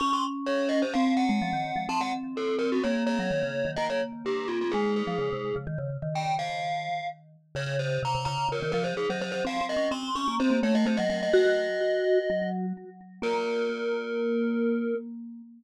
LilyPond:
<<
  \new Staff \with { instrumentName = "Glockenspiel" } { \time 4/4 \key des \major \tempo 4 = 127 des'''16 c'''16 r8 des''8 ees''16 c''16 f''8 ges''4. | a''16 ges''16 r8 a'8 bes'16 ges'16 des''8 des''4. | ees''16 des''16 r8 g'8 f'16 f'16 aes'8 aes'4. | r4 g''8 f''4. r4 |
\key bes \minor des''8 c''8 bes''8 bes''8 bes'8 bes'16 c''16 aes'16 c''16 c''16 c''16 | f''8 ees''8 c'''8 des'''8 c''8 des''16 ees''16 c''16 ees''16 ees''16 ees''16 | ees''2. r4 | bes'1 | }
  \new Staff \with { instrumentName = "Vibraphone" } { \time 4/4 \key des \major des'2 c'8. aes16 f16 ees8 f16 | c'2 bes8. ges16 ees16 des8 ees16 | bes2 aes8. f16 des16 c8 des16 | ees16 des8 ees2~ ees16 r4 |
\key bes \minor des4 c16 c16 des8 des16 ees16 f8 r16 ges8. | \tuplet 3/2 { c'8 c'8 des'8 } c'8 des'16 bes16 c'16 bes16 a8 a16 ges16 ges8 | ges'2 ges4 r4 | bes1 | }
>>